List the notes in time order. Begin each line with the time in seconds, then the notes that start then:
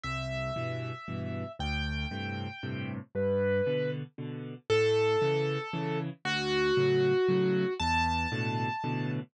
0.03 C2 E5
0.56 G2 B2 E3
1.08 G2 B2 E3
1.59 D2 G5
2.11 G2 A2 C3
2.63 G2 A2 C3
3.15 G2 B4
3.66 B2 D3
4.18 B2 D3
4.70 A2 A4
5.22 C#3 E3
5.73 C#3 E3
6.25 D2 F#4
6.77 A2 C#3 F#3
7.28 A2 C#3 F#3
7.80 E2 A5
8.32 A2 B2 D3
8.84 A2 B2 D3